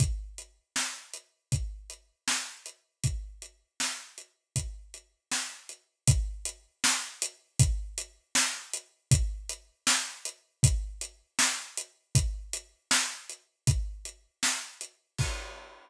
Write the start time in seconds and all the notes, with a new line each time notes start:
0.00 kick, closed hi-hat
0.38 closed hi-hat
0.76 snare
1.14 closed hi-hat
1.52 kick, closed hi-hat
1.90 closed hi-hat
2.28 snare
2.66 closed hi-hat
3.04 kick, closed hi-hat
3.42 closed hi-hat
3.80 snare
4.18 closed hi-hat
4.56 kick, closed hi-hat
4.94 closed hi-hat
5.32 snare
5.69 closed hi-hat
6.07 kick, closed hi-hat
6.45 closed hi-hat
6.84 snare
7.22 closed hi-hat
7.59 kick, closed hi-hat
7.98 closed hi-hat
8.35 snare
8.73 closed hi-hat
9.11 kick, closed hi-hat
9.49 closed hi-hat
9.87 snare
10.25 closed hi-hat
10.63 kick, closed hi-hat
11.01 closed hi-hat
11.39 snare
11.77 closed hi-hat
12.15 kick, closed hi-hat
12.53 closed hi-hat
12.91 snare
13.29 closed hi-hat
13.67 kick, closed hi-hat
14.05 closed hi-hat
14.43 snare
14.81 closed hi-hat
15.18 kick, crash